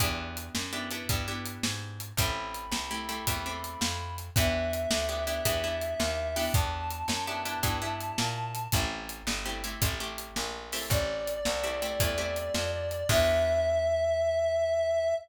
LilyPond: <<
  \new Staff \with { instrumentName = "Clarinet" } { \time 12/8 \key e \minor \tempo 4. = 110 r1. | b''1. | e''1. | a''1. |
r1. | d''1. | e''1. | }
  \new Staff \with { instrumentName = "Acoustic Guitar (steel)" } { \time 12/8 \key e \minor <b d' e' g'>2 <b d' e' g'>8 <b d' e' g'>8 <b d' e' g'>8 <b d' e' g'>2~ <b d' e' g'>8 | <a c' e' g'>2 <a c' e' g'>8 <a c' e' g'>8 <a c' e' g'>8 <a c' e' g'>2~ <a c' e' g'>8 | <b d' e' g'>2 <b d' e' g'>8 <b d' e' g'>8 <b d' e' g'>8 <b d' e' g'>2 <b d' e' g'>8~ | <b d' e' g'>2 <b d' e' g'>8 <b d' e' g'>8 <b d' e' g'>8 <b d' e' g'>2~ <b d' e' g'>8 |
<a c' e' g'>2 <a c' e' g'>8 <a c' e' g'>8 <a c' e' g'>8 <a c' e' g'>2 <a c' e' g'>8~ | <a c' e' g'>2 <a c' e' g'>8 <a c' e' g'>8 <a c' e' g'>8 <a c' e' g'>2~ <a c' e' g'>8 | <b d' e' g'>1. | }
  \new Staff \with { instrumentName = "Electric Bass (finger)" } { \clef bass \time 12/8 \key e \minor e,4. fis,4. g,4. gis,4. | a,,4. c,4. e,4. f,4. | e,4. d,4. e,4. dis,4. | e,4. fis,4. g,4. ais,4. |
a,,4. g,,4. a,,4. ais,,4. | a,,4. c,4. e,4. f,4. | e,1. | }
  \new DrumStaff \with { instrumentName = "Drums" } \drummode { \time 12/8 <hh bd>4 hh8 sn4 hh8 <hh bd>4 hh8 sn4 hh8 | <hh bd>4 hh8 sn4 hh8 <hh bd>4 hh8 sn4 hh8 | <hh bd>4 hh8 sn4 hh8 <hh bd>4 hh8 sn4 hho8 | <hh bd>4 hh8 sn4 hh8 <hh bd>4 hh8 sn4 hh8 |
<hh bd>4 hh8 sn4 hh8 <hh bd>4 hh8 sn4 hho8 | <hh bd>4 hh8 sn4 hh8 <hh bd>4 hh8 sn4 hh8 | <cymc bd>4. r4. r4. r4. | }
>>